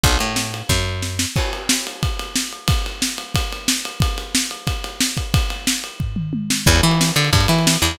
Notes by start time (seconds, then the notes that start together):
0.03 B1, kick, ride
0.19 A2, ride
0.36 snare
0.54 ride
0.69 F#2, kick, snare
1.02 snare
1.19 snare
1.36 kick, crash
1.53 ride
1.69 snare
1.87 ride
2.03 kick, ride
2.19 ride
2.35 snare
2.53 ride
2.68 kick, ride
2.86 ride
3.02 snare
3.18 ride
3.34 kick, ride
3.52 ride
3.68 snare
3.85 ride
4.00 kick, ride
4.18 ride
4.35 snare
4.51 ride
4.67 kick, ride
4.84 ride
5.00 snare
5.17 kick, ride
5.34 kick, ride
5.50 ride
5.67 snare
5.84 ride
6.00 kick, floor tom
6.16 mid tom
6.33 high tom
6.50 snare
6.66 E2, kick, crash
6.76 ride
6.83 E3, ride
6.91 ride
7.01 snare
7.09 ride
7.16 D3, ride
7.25 ride
7.33 G2, kick, ride
7.41 ride
7.48 E3, ride
7.59 ride
7.67 snare
7.74 ride
7.82 E2, ride
7.91 ride